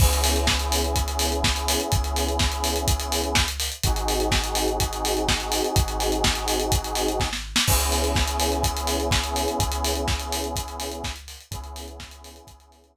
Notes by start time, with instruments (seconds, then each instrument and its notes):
0.00 synth bass 2 C#2, lead 2 (sawtooth) B3 C#4 E4 G#4, kick, crash
0.13 closed hi-hat
0.24 open hi-hat
0.36 closed hi-hat
0.47 kick, snare
0.59 closed hi-hat
0.72 open hi-hat
0.84 closed hi-hat
0.96 kick, closed hi-hat
1.08 closed hi-hat
1.19 open hi-hat
1.32 closed hi-hat
1.44 kick, snare
1.56 closed hi-hat
1.68 open hi-hat
1.80 closed hi-hat
1.92 synth bass 2 C#2, kick, closed hi-hat
2.04 closed hi-hat
2.16 open hi-hat
2.29 closed hi-hat
2.39 kick, snare
2.52 closed hi-hat
2.64 open hi-hat
2.76 closed hi-hat
2.88 kick, closed hi-hat
3.00 closed hi-hat
3.12 open hi-hat
3.24 closed hi-hat
3.35 kick, snare
3.48 closed hi-hat
3.60 open hi-hat
3.72 closed hi-hat
3.83 synth bass 2 G#1, lead 2 (sawtooth) C4 D#4 F#4 G#4, kick, closed hi-hat
3.96 closed hi-hat
4.08 open hi-hat
4.20 closed hi-hat
4.32 kick, snare
4.44 closed hi-hat
4.55 open hi-hat
4.68 closed hi-hat
4.80 kick, closed hi-hat
4.93 closed hi-hat
5.05 open hi-hat
5.17 closed hi-hat
5.28 kick, snare
5.40 closed hi-hat
5.52 open hi-hat
5.64 closed hi-hat
5.76 synth bass 2 G#1, kick, closed hi-hat
5.88 closed hi-hat
6.00 open hi-hat
6.12 closed hi-hat
6.24 kick, snare
6.35 closed hi-hat
6.48 open hi-hat
6.60 closed hi-hat
6.72 kick, closed hi-hat
6.84 closed hi-hat
6.95 open hi-hat
7.08 closed hi-hat
7.20 kick, snare
7.33 snare
7.56 snare
7.67 synth bass 2 C#2, lead 2 (sawtooth) B3 C#4 E4 G#4, kick, crash
7.80 closed hi-hat
7.92 open hi-hat
8.04 closed hi-hat
8.15 kick, snare
8.28 closed hi-hat
8.40 open hi-hat
8.52 closed hi-hat
8.63 kick, closed hi-hat
8.77 closed hi-hat
8.87 open hi-hat
9.00 closed hi-hat
9.11 kick, snare
9.24 closed hi-hat
9.36 open hi-hat
9.48 closed hi-hat
9.59 synth bass 2 C#2, kick, closed hi-hat
9.72 closed hi-hat
9.85 open hi-hat
9.95 closed hi-hat
10.08 kick, snare
10.20 closed hi-hat
10.32 open hi-hat
10.44 closed hi-hat
10.56 kick, closed hi-hat
10.68 closed hi-hat
10.80 open hi-hat
10.92 closed hi-hat
11.04 kick, snare
11.16 closed hi-hat
11.28 open hi-hat
11.40 closed hi-hat
11.51 synth bass 2 C#2, lead 2 (sawtooth) B3 C#4 E4 G#4, kick, closed hi-hat
11.64 closed hi-hat
11.76 open hi-hat
11.88 closed hi-hat
12.00 kick, snare
12.11 closed hi-hat
12.24 open hi-hat
12.36 closed hi-hat
12.47 synth bass 2 C#2, kick, closed hi-hat
12.60 closed hi-hat
12.72 open hi-hat
12.84 closed hi-hat
12.96 kick